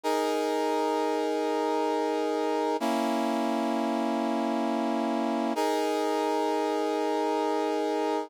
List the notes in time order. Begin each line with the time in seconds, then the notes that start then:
0.03 D#4 G#4 A#4
2.80 A#3 C#4 E4
5.55 D#4 G#4 A#4